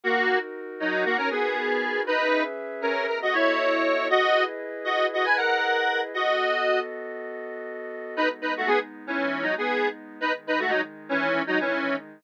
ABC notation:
X:1
M:4/4
L:1/16
Q:1/4=118
K:D#phr
V:1 name="Lead 1 (square)"
[A,F]3 z3 [F,D]2 [A,F] [CA] [B,G]6 | [DB]3 z3 [CA]2 A [Fd] [Ec]6 | [Fd]3 z3 [Fd]2 [Fd] [Bg] [Af]6 | [Fd]6 z10 |
[K:G#phr] [DB] z [DB] [A,F] [B,G] z2 [E,C]3 [F,D] [B,G]3 z2 | [DB] z [DB] [A,F] [F,D] z2 [E,C]3 [F,D] [E,C]3 z2 |]
V:2 name="Pad 2 (warm)"
[DFA]16 | [CGBe]8 [B,F=Ad]8 | [EGBd]16 | [B,F=Ad]16 |
[K:G#phr] [G,B,D]16 | [D,G,D]16 |]